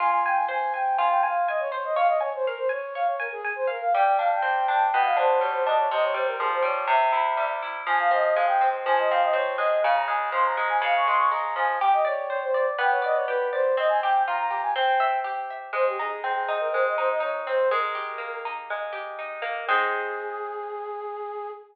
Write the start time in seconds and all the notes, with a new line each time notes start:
0.00 F4 G#5
0.12 G#5
0.26 G5 G#5
0.36 G#5
0.48 C5 G#5
0.73 G5 G#5
0.97 F4 G#5
1.10 G5
1.23 F5 G#5
1.48 D#5 G#5
1.60 C#5
1.71 C5 C#5
1.84 D#5
1.95 C#5 F5
2.07 D#5
2.20 C#5 G#5
2.34 C5
2.46 A#4 F5
2.57 C5
2.69 C#5 G#5
2.95 C#5 F5
3.07 C#5
3.19 A#4 G#5
3.32 G#4
3.44 G#5
3.56 C5
3.67 A#4 F5
3.81 F5
3.94 G3 G5
4.05 G5
4.18 D4 F5
4.32 G5
4.42 C4 G5
4.67 D4 G5
4.91 B2 G5
5.04 F5
5.16 D4 C5
5.39 G3 C#5
5.52 C5
5.65 D4 D#5
5.78 C#5
5.91 C3 D#5
6.03 C#5
6.14 G3 C5
6.27 A#4
6.39 F3 G#4
6.52 C5
6.62 G3 C#5
6.87 C3 E5
7.12 E4
7.37 G3
7.62 E4
7.86 F3 G#5
7.99 F5
8.11 C4 D#5
8.34 G#3 F5
8.47 G5
8.61 C4
8.86 F3 G#5
8.99 D#5
9.10 C4 F5
9.23 D#5
9.33 C4 C#5
9.58 G#3 D#5
9.83 C#3 F5
9.94 A#5
10.07 G#3 G#5
10.32 F3 C6
10.46 A#5
10.57 G#3
10.69 G#5
10.81 C#3 F5
10.96 C#6
11.06 G#3 C6
11.18 C#6
11.31 G#3 A#5
11.56 F3 G#5
11.81 G4 G5
11.93 D#5
12.05 C#5 D5
12.29 C5 C#5
12.42 C5
12.54 D5
12.78 B3 G5
12.91 C#5
13.02 D5 D#5
13.14 C#5
13.27 G4 B4
13.52 C5 D5
13.77 C4 D#5
13.89 G#5
14.02 G4 G5
14.27 F4 A#5
14.38 A#5
14.50 G4
14.62 G#5
14.76 C4 G5
15.00 E5
15.24 G4
15.50 E5
15.73 G#3 C5
15.86 G4
15.98 D#4 G#4
16.23 C4 G#4
16.35 G#4
16.48 D#4
16.60 A#4
16.72 G#3 C5
16.86 D#5
16.97 D#4 C5
17.09 D#5
17.20 D#4 C#5
17.47 C4 C5
17.71 G#3 A#4
17.95 G4
18.18 A#3
18.45 D#4
18.70 G#3
18.92 G4
19.18 D#4
19.42 A#3
19.67 G#3 C4 D#4 G#4